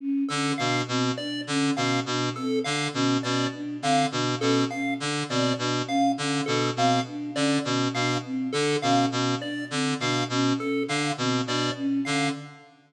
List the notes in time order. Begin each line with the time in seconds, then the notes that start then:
0.00 C#4
0.29 D3 C#4 A4
0.58 B2 D4 F5
0.88 B2 C4
1.18 D4 D5
1.47 D3 C#4
1.75 B2 C#4 F5
2.06 B2 D4
2.36 C4 A4
2.64 D3 D4 F5
2.93 B2 C#4
3.23 B2 C#4 D5
3.54 D4
3.82 D3 C4 F5
4.12 B2 D4
4.40 B2 C#4 A4
4.70 C#4 F5
5.00 D3 D4
5.29 B2 C4 D5
5.58 B2 D4
5.87 C#4 F5
6.18 D3 C#4
6.46 B2 D4 A4
6.76 B2 C4 F5
7.07 D4
7.34 D3 C#4 D5
7.65 B2 C#4
7.94 B2 D4 F5
8.25 C4
8.53 D3 D4 A4
8.82 B2 C#4 F5
9.10 B2 C#4
9.40 D4 D5
9.71 D3 C4
10.00 B2 D4 F5
10.29 B2 C#4
10.58 C#4 A4
10.88 D3 D4 F5
11.18 B2 C4
11.47 B2 D4 D5
11.77 C#4
12.05 D3 C#4 F5